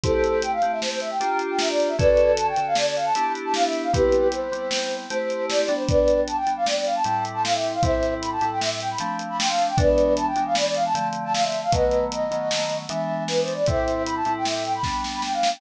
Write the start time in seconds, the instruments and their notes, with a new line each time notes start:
0.03 electric piano 2 A3 C4 E4 G4, flute A4 C5, kick, closed hi-hat
0.24 closed hi-hat
0.42 flute G5, closed hi-hat
0.52 flute F5
0.62 electric piano 2 A3 C4 E4 G4, closed hi-hat
0.72 flute E5
0.81 flute C5, snare
0.91 flute C5
1.00 flute E5, closed hi-hat
1.10 flute G5
1.20 electric piano 2 A#3 D4 F4 G4, closed hi-hat
1.39 closed hi-hat
1.50 flute G5
1.59 flute E5, snare
1.69 flute D5
1.80 closed hi-hat
1.88 flute E5
1.99 electric piano 2 D3 C#4 F#4 A4, flute B4 D5, kick, closed hi-hat
2.17 closed hi-hat
2.37 flute A5, closed hi-hat
2.47 flute G5
2.56 electric piano 2 D3 C#4 F#4 A4, closed hi-hat
2.67 flute F5
2.75 flute D5, snare
2.86 flute D5
2.96 flute F5, closed hi-hat
3.05 flute A5
3.15 electric piano 2 B3 D4 E4 G4, closed hi-hat
3.35 closed hi-hat
3.45 flute A5
3.54 flute F5, snare
3.64 flute E5
3.73 closed hi-hat
3.83 flute F5
3.93 electric piano 2 G3 B3 C4 E4, flute G4 B4, kick, closed hi-hat
4.12 closed hi-hat
4.32 flute C5, closed hi-hat
4.52 electric piano 2 G3 B3 C4 E4, closed hi-hat
4.71 snare
4.91 closed hi-hat
5.10 electric piano 2 A3 C4 E4 G4, flute C5, closed hi-hat
5.30 closed hi-hat
5.49 flute D5, snare
5.62 flute D5
5.68 electric piano 2 G3 B3 D4, closed hi-hat
5.75 flute C5
5.88 flute B4 D5, kick, closed hi-hat
6.08 closed hi-hat
6.27 flute A5, closed hi-hat
6.37 flute G5
6.47 electric piano 2 G3 B3 D4, closed hi-hat
6.56 flute F5
6.66 flute D5, snare
6.76 flute D5
6.85 flute F5, closed hi-hat
6.95 flute A5
7.04 electric piano 2 A2 G3 C4 E4, closed hi-hat
7.25 closed hi-hat
7.34 flute A5
7.44 flute F5, snare
7.54 flute E5
7.64 closed hi-hat
7.73 flute F5
7.83 electric piano 2 A2 G3 C4 E4, flute C5 E5, kick, closed hi-hat
8.03 closed hi-hat
8.21 flute B5, closed hi-hat
8.32 flute A5
8.41 electric piano 2 A2 G3 C4 E4, closed hi-hat
8.51 flute G5
8.61 flute E5, snare
8.71 flute E5
8.80 flute G5, closed hi-hat
8.91 flute B5
8.98 electric piano 2 F3 A3 C4 D4, closed hi-hat
9.19 closed hi-hat
9.29 flute B5
9.39 flute G5, snare
9.48 flute F5
9.59 closed hi-hat
9.68 flute G5
9.77 electric piano 2 E3 G#3 B3 D4, flute B4 D5, kick, closed hi-hat
9.98 closed hi-hat
10.17 flute A5, closed hi-hat
10.27 flute G5
10.36 electric piano 2 E3 G#3 B3 D4, closed hi-hat
10.46 flute F5
10.55 flute D5, snare
10.65 flute D5
10.74 flute F5, closed hi-hat
10.85 flute A5
10.94 electric piano 2 D3 F3 A3 C4, closed hi-hat
11.13 closed hi-hat
11.24 flute A5
11.33 flute F5, snare
11.43 flute E5
11.52 closed hi-hat
11.63 flute F5
11.72 electric piano 2 D#3 F#3 A3 B3, flute B4 D#5, kick, closed hi-hat
11.91 closed hi-hat
12.12 flute D#5, closed hi-hat
12.31 electric piano 2 D#3 F#3 A3 B3, closed hi-hat
12.51 snare
12.70 closed hi-hat
12.89 electric piano 2 E3 G#3 B3 D4, flute E5, closed hi-hat
13.28 flute B4, snare
13.41 flute C5
13.48 closed hi-hat
13.54 flute D5
13.66 electric piano 2 A2 G3 C4 E4, flute C5 E5, kick, closed hi-hat
13.88 closed hi-hat
14.06 flute B5, closed hi-hat
14.16 flute A5
14.25 electric piano 2 A2 G3 C4 E4, closed hi-hat
14.36 flute G5
14.45 flute E5, snare
14.55 flute E5
14.64 flute G5, closed hi-hat
14.75 flute B5
14.83 electric piano 2 G3 B3 D4, kick, snare
15.04 snare
15.13 flute B5
15.22 flute G5, snare
15.33 flute F5
15.43 snare
15.53 flute G5